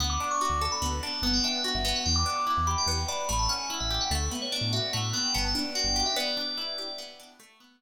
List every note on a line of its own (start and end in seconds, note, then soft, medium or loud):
0.00 0.18 D2 medium
0.00 0.81 B3 medium
0.00 0.10 F#5 medium
0.10 0.30 D6 medium
0.20 1.02 D4 medium
0.31 0.40 C#6 medium
0.41 1.19 F#4 medium
0.41 0.60 D6 medium
0.50 0.68 D2 medium
0.61 1.20 A4 medium
0.61 0.71 A5 medium
0.72 0.82 B5 medium
0.82 1.00 D2 medium
0.82 1.21 B3 medium
1.03 1.22 D4 medium
1.03 1.23 A5 medium
1.22 1.41 G1 medium
1.22 1.84 B3 medium
1.22 1.33 A5 medium
1.33 1.43 G5 medium
1.44 2.02 D4 medium
1.44 1.70 E5 medium
1.64 2.03 F#4 medium
1.75 1.93 G1 medium
1.75 1.95 E5 medium
1.85 2.87 B3 medium
1.96 2.06 F#5 medium
2.06 2.24 E2 medium
2.06 2.15 G5 medium
2.16 2.36 D6 medium
2.26 3.08 D4 medium
2.36 2.46 D6 medium
2.47 3.25 E4 medium
2.47 2.64 D6 medium
2.57 2.76 E2 medium
2.67 3.26 G4 medium
2.67 2.77 B5 medium
2.78 2.88 G5 medium
2.86 3.05 E2 medium
2.86 3.27 B3 medium
3.08 3.28 D4 medium
3.08 3.26 B5 medium
3.29 3.48 A1 medium
3.29 4.07 A3 medium
3.29 3.39 B5 medium
3.39 3.49 A5 medium
3.49 4.08 C#4 medium
3.49 3.76 F#5 medium
3.70 4.09 E4 medium
3.80 3.99 A1 medium
3.80 3.98 E5 medium
3.90 4.10 G4 medium
4.01 4.11 F#5 medium
4.11 4.29 D2 loud
4.11 4.93 A3 medium
4.11 4.21 F#5 loud
4.31 5.13 B3 medium
4.42 4.52 C#5 medium
4.52 5.30 D4 medium
4.52 4.68 D5 medium
4.61 4.80 A2 medium
4.73 5.31 F#4 medium
4.73 4.83 E5 medium
4.93 5.13 A2 medium
4.93 5.32 A3 medium
4.93 5.12 F#5 medium
5.13 5.33 B3 medium
5.13 5.32 G5 medium
5.34 5.54 G1 medium
5.34 6.12 B3 medium
5.34 5.44 A5 medium
5.45 5.54 A5 medium
5.55 6.14 D4 medium
5.75 6.14 F#4 medium
5.75 6.04 G5 medium
5.84 6.03 G1 medium
5.96 6.15 G4 medium
6.06 6.16 E5 medium
6.16 6.98 B3 medium
6.16 6.93 D5 loud
6.37 7.19 D4 medium
6.57 7.36 E4 medium
6.78 7.37 G4 medium
6.98 7.37 B3 medium
7.20 7.39 D4 medium
7.40 7.81 A3 medium
7.60 7.81 B3 medium